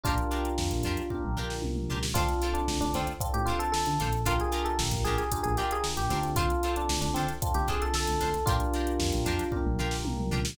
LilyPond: <<
  \new Staff \with { instrumentName = "Electric Piano 1" } { \time 4/4 \key d \minor \tempo 4 = 114 <d' f'>2~ <d' f'>8 r4. | f'8. d'8 d'16 c'16 r8 g'16 f'16 a'16 a'4 | f'16 gis'8 a'16 r8 aes'16 aes'8 aes'16 g'16 aes'16 r16 g'8. | f'8. d'8 d'16 c'16 r8 g'16 gis'16 a'16 a'4 |
<d' f'>2~ <d' f'>8 r4. | }
  \new Staff \with { instrumentName = "Acoustic Guitar (steel)" } { \time 4/4 \key d \minor <d' f' g' bes'>8 <d' f' g' bes'>4 <d' f' g' bes'>4 <d' f' g' bes'>4 <d' f' g' bes'>8 | <d' f' a' c''>8 <d' f' a' c''>4 <d' f' a' c''>4 <d' f' a' c''>4 <d' f' a' c''>8 | <d' f' g' bes'>8 <d' f' g' bes'>4 <d' f' g' bes'>4 <d' f' g' bes'>4 <d' f' g' bes'>8 | <d' f' a' c''>8 <d' f' a' c''>4 <d' f' a' c''>4 <d' f' a' c''>4 <d' f' a' c''>8 |
<d' f' g' bes'>8 <d' f' g' bes'>4 <d' f' g' bes'>4 <d' f' g' bes'>4 <d' f' g' bes'>8 | }
  \new Staff \with { instrumentName = "Electric Piano 1" } { \time 4/4 \key d \minor <d' f' g' bes'>2 <d' f' g' bes'>2 | <c' d' f' a'>2 <c' d' f' a'>2 | <d' f' g' bes'>2 <d' f' g' bes'>4. <c' d' f' a'>8~ | <c' d' f' a'>2 <c' d' f' a'>2 |
<d' f' g' bes'>2 <d' f' g' bes'>2 | }
  \new Staff \with { instrumentName = "Synth Bass 1" } { \clef bass \time 4/4 \key d \minor bes,,4 f,16 bes,,16 f,8. bes,,8. c,8 cis,8 | d,4 d,16 d,16 d,8. a,4 d16 bes,,8~ | bes,,4 bes,,16 bes,,16 bes,,8. bes,,4 bes,,16 d,8~ | d,4 d,16 d,16 d8. d,4 d,16 d,8 |
bes,,4 f,16 bes,,16 f,8. bes,,8. c,8 cis,8 | }
  \new DrumStaff \with { instrumentName = "Drums" } \drummode { \time 4/4 <hh bd>16 hh16 hh16 hh16 sn16 hh16 hh16 hh16 <bd tommh>16 toml16 tomfh16 sn16 tommh16 toml16 tomfh16 sn16 | <hh bd>16 hh16 hh16 hh16 sn16 hh16 hh16 hh16 <hh bd>16 hh16 hh16 hh16 sn16 hh16 <hh sn>16 hh16 | <hh bd>16 hh16 hh16 hh16 sn16 <hh bd>16 hh16 hh16 <hh bd>16 hh16 hh16 hh16 sn16 hh16 <hh sn>16 hh16 | <hh bd>16 hh16 hh16 hh16 sn16 hh16 hh16 hh16 <hh bd>16 <hh sn>16 <hh bd>16 hh16 sn16 hh16 <hh sn>16 hh16 |
<hh bd>16 hh16 hh16 hh16 sn16 hh16 hh16 hh16 <bd tommh>16 toml16 tomfh16 sn16 tommh16 toml16 tomfh16 sn16 | }
>>